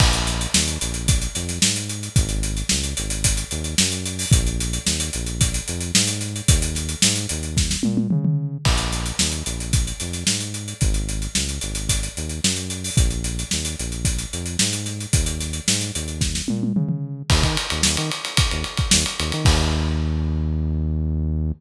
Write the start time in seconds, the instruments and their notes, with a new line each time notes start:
0.00 synth bass 1 A#1, kick, crash
0.13 closed hi-hat
0.27 snare, closed hi-hat
0.41 closed hi-hat
0.54 synth bass 1 D#2, snare
0.68 closed hi-hat
0.81 synth bass 1 A#1, closed hi-hat
0.94 closed hi-hat
1.08 kick, closed hi-hat
1.22 closed hi-hat
1.35 synth bass 1 F2, snare, closed hi-hat
1.49 snare, closed hi-hat
1.62 synth bass 1 G#2, snare
1.76 closed hi-hat
1.89 closed hi-hat
2.03 closed hi-hat
2.16 synth bass 1 G#1, kick, closed hi-hat
2.29 closed hi-hat
2.43 closed hi-hat
2.57 closed hi-hat
2.69 synth bass 1 C#2, snare
2.84 closed hi-hat
2.97 synth bass 1 G#1, closed hi-hat
3.10 closed hi-hat
3.24 kick, closed hi-hat
3.37 closed hi-hat
3.51 synth bass 1 D#2, closed hi-hat
3.64 closed hi-hat
3.78 synth bass 1 F#2, snare
3.92 closed hi-hat
4.06 closed hi-hat
4.19 open hi-hat
4.32 synth bass 1 A#1, kick, closed hi-hat
4.47 closed hi-hat
4.60 closed hi-hat
4.73 closed hi-hat
4.86 synth bass 1 D#2, snare
5.00 closed hi-hat
5.13 synth bass 1 A#1, closed hi-hat
5.26 closed hi-hat
5.41 kick, closed hi-hat
5.54 closed hi-hat
5.68 synth bass 1 F2, closed hi-hat
5.81 closed hi-hat
5.95 synth bass 1 G#2, snare
6.07 closed hi-hat
6.21 snare, closed hi-hat
6.36 closed hi-hat
6.48 synth bass 1 D#2, kick, closed hi-hat
6.62 closed hi-hat
6.75 snare, closed hi-hat
6.89 closed hi-hat
7.02 synth bass 1 G#2, snare
7.16 snare, closed hi-hat
7.29 synth bass 1 D#2, closed hi-hat
7.43 closed hi-hat
7.57 kick, snare
7.71 snare
7.83 synth bass 1 A#2, high tom
7.97 high tom
8.10 synth bass 1 C#3, mid tom
8.25 mid tom
8.65 synth bass 1 A#1, kick, crash
8.77 closed hi-hat
8.92 snare, closed hi-hat
9.06 closed hi-hat
9.19 synth bass 1 D#2, snare
9.32 closed hi-hat
9.46 synth bass 1 A#1, closed hi-hat
9.60 closed hi-hat
9.73 kick, closed hi-hat
9.87 closed hi-hat
10.00 synth bass 1 F2, snare, closed hi-hat
10.13 snare, closed hi-hat
10.27 synth bass 1 G#2, snare
10.40 closed hi-hat
10.54 closed hi-hat
10.68 closed hi-hat
10.81 synth bass 1 G#1, kick, closed hi-hat
10.94 closed hi-hat
11.09 closed hi-hat
11.22 closed hi-hat
11.35 synth bass 1 C#2, snare
11.49 closed hi-hat
11.61 synth bass 1 G#1, closed hi-hat
11.75 closed hi-hat
11.89 kick, closed hi-hat
12.03 closed hi-hat
12.17 synth bass 1 D#2, closed hi-hat
12.29 closed hi-hat
12.44 synth bass 1 F#2, snare
12.56 closed hi-hat
12.70 closed hi-hat
12.84 open hi-hat
12.97 synth bass 1 A#1, kick, closed hi-hat
13.10 closed hi-hat
13.24 closed hi-hat
13.39 closed hi-hat
13.51 synth bass 1 D#2, snare
13.65 closed hi-hat
13.79 synth bass 1 A#1, closed hi-hat
13.92 closed hi-hat
14.05 kick, closed hi-hat
14.18 closed hi-hat
14.33 synth bass 1 F2, closed hi-hat
14.46 closed hi-hat
14.59 synth bass 1 G#2, snare
14.73 closed hi-hat
14.86 snare, closed hi-hat
15.00 closed hi-hat
15.13 synth bass 1 D#2, kick, closed hi-hat
15.26 closed hi-hat
15.40 snare, closed hi-hat
15.53 closed hi-hat
15.68 synth bass 1 G#2, snare
15.81 snare, closed hi-hat
15.95 synth bass 1 D#2, closed hi-hat
16.08 closed hi-hat
16.21 kick, snare
16.35 snare
16.48 synth bass 1 A#2, high tom
16.63 high tom
16.76 synth bass 1 C#3, mid tom
16.89 mid tom
17.30 synth bass 1 D#2, kick, crash
17.43 synth bass 1 D#3, kick, ride
17.57 ride
17.70 synth bass 1 D#2, ride
17.83 synth bass 1 D#2, snare
17.97 synth bass 1 D#3, ride
18.11 ride
18.25 ride
18.37 kick, ride
18.51 synth bass 1 D#2, ride
18.64 ride
18.77 kick, ride
18.91 synth bass 1 D#2, snare
19.06 ride
19.19 synth bass 1 D#2, ride
19.32 synth bass 1 D#3, ride
19.45 synth bass 1 D#2, kick, crash